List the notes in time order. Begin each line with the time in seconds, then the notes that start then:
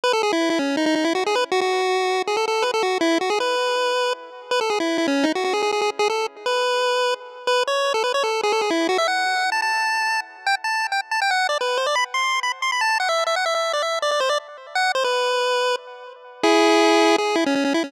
0.04 B4
0.13 A4
0.23 G#4
0.33 E4
0.50 E4
0.59 C#4
0.77 D#4
0.86 D#4
0.95 D#4
1.04 E4
1.15 F#4
1.26 G#4
1.35 B4
1.52 F#4
1.61 F#4
2.27 G#4
2.37 A4
2.48 A4
2.62 B4
2.74 A4
2.83 F#4
3.01 E4
3.21 F#4
3.30 G#4
3.40 B4
4.51 B4
4.61 A4
4.70 G#4
4.80 E4
4.98 E4
5.08 C#4
5.24 D#4
5.35 F#4
5.44 F#4
5.53 G#4
5.63 G#4
5.72 G#4
5.81 G#4
5.99 G#4
6.10 A4
6.46 B4
7.47 B4
7.67 C#5
7.94 A4
8.04 B4
8.14 C#5
8.23 A4
8.43 G#4
8.52 A4
8.61 G#4
8.70 E4
8.89 F#4
8.98 E5
9.08 F#5
9.52 A5
9.62 A5
10.47 G5
10.64 A5
10.92 G5
11.11 A5
11.22 G5
11.31 F#5
11.49 D5
11.61 B4
11.77 C5
11.86 D5
11.95 B5
12.14 C6
12.43 B5
12.62 C6
12.72 B5
12.81 A5
13.00 F#5
13.09 E5
13.27 E5
13.36 F#5
13.46 E5
13.55 E5
13.73 D5
13.82 E5
14.02 D5
14.11 D5
14.20 C5
14.29 D5
14.75 F#5
14.95 C5
15.04 B4
16.43 E4 G#4
17.18 G#4
17.35 E4
17.46 C#4
17.55 C#4
17.65 C#4
17.74 E4
17.84 C#4